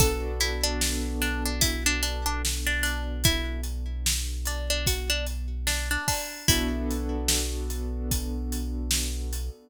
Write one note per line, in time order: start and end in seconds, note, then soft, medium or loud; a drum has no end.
0.00 5.97 B1 loud
0.00 6.38 B3 medium
0.00 6.38 D4 medium
0.00 6.38 F#4 medium
0.00 0.39 A4 medium
0.00 6.38 A4 medium
0.00 kick medium
0.00 closed hi-hat loud
0.40 0.63 E4 medium
0.40 closed hi-hat medium
0.64 1.14 D4 medium
0.81 snare loud
1.22 1.44 D4 medium
1.22 closed hi-hat medium
1.45 1.62 D4 medium
1.61 1.84 E4 medium
1.61 kick medium
1.61 closed hi-hat loud
1.86 2.02 D4 medium
2.03 2.25 D4 medium
2.03 closed hi-hat medium
2.26 2.42 D4 medium
2.45 snare medium
2.67 2.83 D4 medium
2.83 3.22 D4 medium
2.83 closed hi-hat medium
3.24 3.61 E4 medium
3.24 kick loud
3.24 closed hi-hat medium
3.64 closed hi-hat medium
4.06 snare loud
4.45 4.69 D4 medium
4.45 closed hi-hat medium
4.70 4.86 D4 medium
4.86 5.09 F#4 medium
4.86 kick medium
4.86 closed hi-hat medium
5.10 5.26 D4 medium
5.27 closed hi-hat medium
5.67 5.89 D4 medium
5.67 snare medium
5.91 6.07 D4 medium
6.08 6.47 D4 medium
6.08 kick medium
6.08 open hi-hat medium
6.48 9.50 B1 loud
6.48 9.68 B3 medium
6.48 9.68 D4 medium
6.48 7.60 E4 medium
6.48 9.68 F#4 medium
6.48 9.68 A4 medium
6.48 kick medium
6.48 closed hi-hat loud
6.91 closed hi-hat medium
7.28 snare loud
7.70 closed hi-hat medium
8.11 kick medium
8.11 closed hi-hat medium
8.52 closed hi-hat medium
8.91 snare loud
9.33 closed hi-hat medium